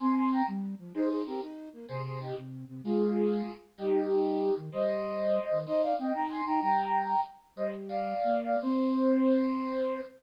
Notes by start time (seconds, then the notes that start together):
0.00 C4 G#5 C6
0.17 G#5 C6
0.32 G5 A#5
0.47 G3
0.79 F3
0.94 D#4 G#4 C5
1.09 G#4 C5
1.26 C4 G4 A#4
1.42 D#4
1.73 A#3
1.88 C3 G#4 C5
2.05 G#4 C5
2.20 D#4 G4
2.36 C3
2.68 C3
2.84 G#3 F4 G#4
3.78 G3 D#4 G4
4.57 D#3
4.72 G3 C5 D#5
5.51 D#3
5.66 D#4 C5 D#5
5.82 D5 F5
5.98 C4 D#5 G5
6.13 D#4 G5 A#5
6.29 G#5 C6
6.46 D#4 G5 A#5
6.61 G3 G5 A#5
7.56 G3 C5 D#5
7.89 D5 F5
8.24 A#3
8.43 D5 F5
8.62 C4 C5